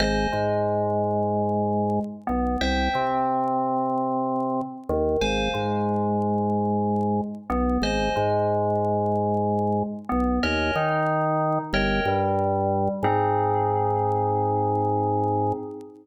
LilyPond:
<<
  \new Staff \with { instrumentName = "Electric Piano 2" } { \time 4/4 \key aes \major \tempo 4 = 92 <c'' ees'' aes''>8 aes2. b8 | <c'' e'' g''>8 c'2. ees8 | <c'' f'' aes''>8 aes2. b8 | <c'' ees'' aes''>8 aes2. b8 |
<bes' des'' ees'' aes''>8 ees'4. <bes' des'' ees'' g''>8 g4. | <c' ees' aes'>1 | }
  \new Staff \with { instrumentName = "Drawbar Organ" } { \clef bass \time 4/4 \key aes \major aes,,8 aes,2. b,,8 | c,8 c2. ees,8 | aes,,8 aes,2. b,,8 | aes,,8 aes,2. b,,8 |
ees,8 ees4. g,,8 g,4. | aes,1 | }
>>